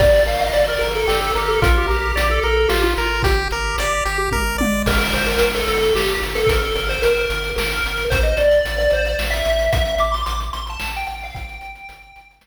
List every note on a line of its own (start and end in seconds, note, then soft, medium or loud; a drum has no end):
0.00 0.23 G1 medium
0.00 0.24 G4 medium
0.00 0.24 D5 loud
0.00 kick loud
0.00 crash loud
0.26 0.50 G1 medium
0.26 0.50 A#4 medium
0.26 0.40 F5 medium
0.26 closed hi-hat medium
0.41 0.53 D#5 medium
0.53 0.77 G1 medium
0.53 0.66 D5 medium
0.53 0.78 D5 medium
0.53 closed hi-hat medium
0.68 0.78 A#4 medium
0.79 1.04 G1 medium
0.79 0.92 A#4 medium
0.79 1.06 A#4 medium
0.79 closed hi-hat medium
0.95 1.20 A4 medium
1.07 1.31 G1 medium
1.07 1.32 G4 medium
1.07 snare loud
1.21 1.34 A4 loud
1.35 1.58 G1 medium
1.35 1.50 G4 medium
1.35 1.60 A#4 medium
1.35 closed hi-hat medium
1.48 1.61 A4 loud
1.62 1.85 A#1 medium
1.62 1.86 F4 medium
1.62 1.75 A#4 loud
1.62 kick loud
1.62 closed hi-hat loud
1.77 1.90 G4 medium
1.88 2.12 A#1 medium
1.88 2.29 G4 medium
1.88 2.12 A#4 medium
1.88 closed hi-hat medium
2.16 2.39 A#1 medium
2.16 2.40 D5 medium
2.16 closed hi-hat loud
2.31 2.43 A4 loud
2.43 2.66 A#1 medium
2.43 2.56 A4 medium
2.43 2.68 A#4 medium
2.43 closed hi-hat medium
2.57 2.69 A4 medium
2.68 2.95 A1 medium
2.68 2.94 F4 medium
2.68 2.81 G4 medium
2.68 snare loud
2.83 3.22 F4 loud
2.96 3.22 G#1 medium
2.96 3.22 A#4 medium
2.96 closed hi-hat medium
3.23 3.47 G1 medium
3.23 3.48 G4 medium
3.23 4.18 G4 loud
3.23 kick loud
3.23 closed hi-hat loud
3.51 3.74 G1 medium
3.51 3.77 A#4 medium
3.51 closed hi-hat medium
3.78 4.01 G1 medium
3.78 4.04 D5 medium
3.78 closed hi-hat loud
4.05 4.28 G1 medium
4.05 4.30 G4 medium
4.05 closed hi-hat medium
4.31 4.56 G1 medium
4.31 4.57 A#4 medium
4.31 kick medium
4.31 high tom medium
4.58 4.83 G1 medium
4.58 4.83 D5 medium
4.58 high tom loud
4.86 5.09 G1 loud
4.86 5.13 A#4 loud
4.86 kick loud
4.86 crash loud
5.02 closed hi-hat medium
5.13 5.36 G1 medium
5.13 5.26 C5 medium
5.13 closed hi-hat medium
5.27 5.51 A#4 medium
5.27 closed hi-hat medium
5.39 5.64 G1 medium
5.39 closed hi-hat loud
5.54 5.67 A4 loud
5.54 closed hi-hat medium
5.67 5.91 G1 medium
5.67 5.94 A4 medium
5.67 closed hi-hat medium
5.82 closed hi-hat medium
5.95 6.18 G1 medium
5.95 6.20 G4 medium
5.95 snare loud
6.08 closed hi-hat medium
6.22 6.45 G1 medium
6.22 closed hi-hat medium
6.35 6.48 A4 medium
6.35 closed hi-hat medium
6.47 6.72 G1 medium
6.47 6.61 A#4 medium
6.47 kick loud
6.47 closed hi-hat loud
6.62 6.77 A4 medium
6.62 closed hi-hat medium
6.75 6.99 G1 medium
6.75 6.88 A#4 medium
6.75 closed hi-hat medium
6.89 7.02 C5 medium
6.89 closed hi-hat medium
7.02 7.26 G1 medium
7.02 7.50 A#4 loud
7.02 closed hi-hat loud
7.17 closed hi-hat medium
7.30 7.53 G1 medium
7.30 closed hi-hat loud
7.44 closed hi-hat medium
7.56 7.80 G1 medium
7.56 8.05 A#4 loud
7.56 snare loud
7.72 closed hi-hat medium
7.84 8.07 G1 medium
7.84 closed hi-hat medium
7.97 closed hi-hat medium
8.10 8.34 A1 medium
8.10 8.23 C5 loud
8.10 kick loud
8.10 closed hi-hat loud
8.23 8.36 D#5 medium
8.23 closed hi-hat medium
8.37 8.61 A1 medium
8.37 8.77 D5 medium
8.37 closed hi-hat medium
8.51 closed hi-hat medium
8.65 8.88 A1 medium
8.65 closed hi-hat loud
8.78 8.91 D5 medium
8.78 closed hi-hat medium
8.90 9.15 A1 medium
8.90 9.06 C5 medium
8.90 closed hi-hat medium
9.05 9.19 D5 medium
9.05 closed hi-hat medium
9.19 9.42 A1 medium
9.19 snare loud
9.30 9.63 E5 medium
9.30 closed hi-hat medium
9.45 9.69 A1 medium
9.45 closed hi-hat medium
9.59 closed hi-hat medium
9.73 9.96 A1 medium
9.73 9.95 E5 loud
9.73 kick loud
9.73 closed hi-hat loud
9.85 closed hi-hat medium
9.98 10.23 A1 medium
9.98 10.13 D6 medium
9.98 closed hi-hat medium
10.12 10.25 C6 loud
10.12 closed hi-hat medium
10.26 10.50 A1 medium
10.26 10.39 D6 medium
10.26 closed hi-hat loud
10.40 closed hi-hat medium
10.53 10.77 A1 medium
10.53 10.66 C6 medium
10.53 closed hi-hat medium
10.67 10.92 A5 loud
10.67 closed hi-hat medium
10.80 11.04 A1 medium
10.80 snare loud
10.96 11.07 G5 medium
10.96 closed hi-hat medium
11.07 11.31 A1 medium
11.07 11.20 G5 loud
11.07 closed hi-hat medium
11.20 11.36 F5 medium
11.20 open hi-hat medium
11.35 11.58 G1 medium
11.35 12.33 G5 loud
11.35 kick loud
11.35 closed hi-hat loud
11.49 closed hi-hat medium
11.61 11.85 G1 medium
11.61 closed hi-hat medium
11.75 closed hi-hat medium
11.89 12.12 G1 medium
11.89 closed hi-hat loud
12.02 closed hi-hat medium
12.16 12.39 G1 medium
12.16 closed hi-hat medium
12.31 closed hi-hat medium
12.41 12.47 G1 medium
12.41 snare loud